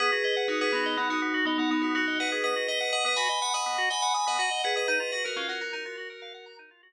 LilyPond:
<<
  \new Staff \with { instrumentName = "Tubular Bells" } { \time 5/4 \key dis \phrygian \tempo 4 = 123 <gis' b'>8 <gis' b'>8 <dis' fis'>16 <gis' b'>16 <b dis'>8 <b dis'>16 <dis' fis'>8. <b dis'>16 <b dis'>16 <b dis'>16 <dis' fis'>16 <dis' fis'>8 <b' dis''>16 <gis' b'>16 | <b' dis''>8 <b' dis''>8 <dis'' fis''>16 <b' dis''>16 <gis'' b''>8 <gis'' b''>16 <dis'' fis''>8. <gis'' b''>16 <gis'' b''>16 <gis'' b''>16 <dis'' fis''>16 <dis'' fis''>8 <gis' b'>16 <b' dis''>16 | <b' dis''>8 <b' dis''>16 <fis' ais'>16 <cis' eis'>16 <fis' ais'>16 <fis' ais'>16 <fis' ais'>16 <fis' ais'>4. r4. | }
  \new Staff \with { instrumentName = "Drawbar Organ" } { \time 5/4 \key dis \phrygian b16 fis'16 dis''16 fis''16 dis'''16 b16 fis'16 dis''16 fis''16 dis'''16 b16 fis'16 dis''16 fis''16 dis'''16 b16 fis'16 dis''16 fis''16 dis'''16 | b16 fis'16 dis''16 fis''16 dis'''16 b16 fis'16 dis''16 fis''16 dis'''16 b16 fis'16 dis''16 fis''16 dis'''16 b16 fis'16 dis''16 fis''16 dis'''16 | dis'16 eis'16 fis'16 ais'16 eis''16 fis''16 ais''16 dis'16 eis'16 fis'16 ais'16 eis''16 fis''16 ais''16 dis'16 eis'16 fis'16 r8. | }
>>